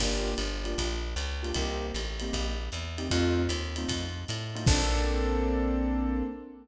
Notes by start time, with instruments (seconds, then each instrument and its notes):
0.00 electric bass (finger) G1, acoustic grand piano A#3 D4 F4 G4, kick, crash, ride
0.38 electric bass (finger) G1, hi-hat pedal, ride
0.64 acoustic grand piano A#3 D4 F4 G4, ride
0.78 electric bass (finger) A#1, kick, ride
1.16 electric bass (finger) C#2, hi-hat pedal, ride
1.43 acoustic grand piano A#3 D4 F4 G4, ride
1.54 electric bass (finger) C2, acoustic grand piano A#3 C4 D#4 G4, kick, ride
1.94 electric bass (finger) A1, hi-hat pedal, ride
2.20 acoustic grand piano A#3 C4 D#4 G4, ride
2.33 electric bass (finger) A#1, kick, ride
2.72 electric bass (finger) E2, hi-hat pedal, ride
2.98 acoustic grand piano A#3 C4 D#4 G4, ride
3.10 electric bass (finger) F2, acoustic grand piano A3 C4 D#4 F4, kick, ride
3.49 electric bass (finger) D#2, hi-hat pedal, ride
3.76 acoustic grand piano A3 C4 D#4 F4, ride
3.88 electric bass (finger) F2, kick, ride
4.28 electric bass (finger) A2, hi-hat pedal, ride
4.55 acoustic grand piano A3 C4 D#4 F4, ride
4.66 electric bass (finger) A#1, acoustic grand piano A#3 C4 D4 A4, kick, crash